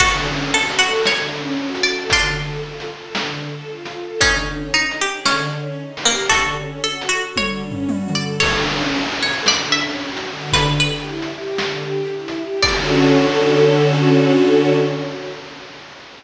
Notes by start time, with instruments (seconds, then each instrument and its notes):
0.00 string ensemble 1 D3, pizzicato strings F#4 A4, kick, crash
0.26 string ensemble 1 C#4
0.53 string ensemble 1 F#4, pizzicato strings A4
0.70 closed hi-hat
0.79 pizzicato strings F#4, string ensemble 1 A4
1.05 string ensemble 1 D3, pizzicato strings C#5, snare
1.32 string ensemble 1 C#4
1.57 string ensemble 1 F#4
1.75 closed hi-hat
1.83 string ensemble 1 A4, pizzicato strings D5
2.10 string ensemble 1 D3, pizzicato strings D4 F4, kick, closed hi-hat
2.37 string ensemble 1 A4
2.62 string ensemble 1 F4
2.80 closed hi-hat
2.89 string ensemble 1 A4
3.15 string ensemble 1 D3, snare
3.42 string ensemble 1 A4
3.68 string ensemble 1 F4
3.85 closed hi-hat
3.95 string ensemble 1 A4
4.21 string ensemble 1 D3, pizzicato strings C#4 D#4, kick, closed hi-hat
4.47 string ensemble 1 C#4
4.72 string ensemble 1 D#4, pizzicato strings D#4
4.91 closed hi-hat
4.99 pizzicato strings G4, string ensemble 1 G#4
5.25 string ensemble 1 D3, pizzicato strings C#4, snare
5.53 string ensemble 1 C#4
5.78 string ensemble 1 D#4
5.97 open hi-hat
6.05 pizzicato strings A#3, string ensemble 1 G4
6.29 string ensemble 1 D3, pizzicato strings F#4 A4, kick, closed hi-hat
6.57 string ensemble 1 C#4
6.83 string ensemble 1 F#4, pizzicato strings A4
7.01 closed hi-hat
7.09 pizzicato strings F#4, string ensemble 1 A4
7.36 string ensemble 1 D3, pizzicato strings C#5, kick, high tom
7.63 string ensemble 1 C#4
7.71 floor tom
7.89 string ensemble 1 F#4, high tom
8.08 mid tom
8.15 string ensemble 1 A4, pizzicato strings D5
8.40 string ensemble 1 D3, pizzicato strings A4 C#5, kick, crash
8.69 string ensemble 1 C#4
8.95 string ensemble 1 F#4
9.12 closed hi-hat
9.21 string ensemble 1 A4, pizzicato strings C#5
9.46 string ensemble 1 D3, pizzicato strings D5, snare
9.72 string ensemble 1 C#4, pizzicato strings E5
10.00 string ensemble 1 F#4
10.17 closed hi-hat
10.27 string ensemble 1 D3
10.53 pizzicato strings B4, kick, closed hi-hat
10.80 string ensemble 1 G4, pizzicato strings B4
11.05 string ensemble 1 E4
11.22 closed hi-hat
11.32 string ensemble 1 G4
11.58 string ensemble 1 D3, snare
11.83 string ensemble 1 G4
12.11 string ensemble 1 E4
12.28 closed hi-hat
12.37 string ensemble 1 G4
12.63 string ensemble 1 D3 C#4, pizzicato strings D5, kick, crash
12.67 string ensemble 1 F#4 A4